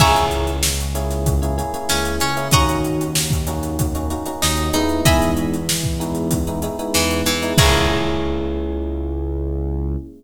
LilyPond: <<
  \new Staff \with { instrumentName = "Acoustic Guitar (steel)" } { \time 4/4 \key cis \dorian \tempo 4 = 95 <e'' gis'' ais'' cis'''>8 r2 r8 cis'8 cis'8 | <dis'' fis'' ais'' cis'''>8 r2 r8 dis'8 dis'8 | <dis'' e'' gis'' b''>8 r2 r8 e8 e8 | <e' gis' ais' cis''>1 | }
  \new Staff \with { instrumentName = "Electric Piano 1" } { \time 4/4 \key cis \dorian <ais cis' e' gis'>4. <ais cis' e' gis'>8. <ais cis' e' gis'>16 <ais cis' e' gis'>16 <ais cis' e' gis'>4 <ais cis' e' gis'>16 | <ais cis' dis' fis'>4. <ais cis' dis' fis'>8. <ais cis' dis' fis'>16 <ais cis' dis' fis'>16 <ais cis' dis' fis'>8. <gis b dis' e'>8~ | <gis b dis' e'>4. <gis b dis' e'>8. <gis b dis' e'>16 <gis b dis' e'>16 <gis b dis' e'>4 <gis b dis' e'>16 | <ais cis' e' gis'>1 | }
  \new Staff \with { instrumentName = "Synth Bass 1" } { \clef bass \time 4/4 \key cis \dorian cis,2. cis,8 cis,8 | dis,2. dis,8 dis,8 | e,2. e,8 e,8 | cis,1 | }
  \new DrumStaff \with { instrumentName = "Drums" } \drummode { \time 4/4 <cymc bd>16 hh16 hh16 hh16 sn16 hh16 hh16 <hh sn>16 <hh bd>16 hh16 hh16 hh16 sn16 hh16 hh16 hh16 | <hh bd>16 hh16 hh16 hh16 sn16 <hh bd>16 hh16 hh16 <hh bd>16 hh16 hh16 hh16 sn16 hh16 <hh sn>16 hh16 | <hh bd>16 hh16 hh16 hh16 sn16 bd16 hh16 hh16 <hh bd>16 hh16 hh16 hh16 sn16 hh16 hh16 <hh sn>16 | <cymc bd>4 r4 r4 r4 | }
>>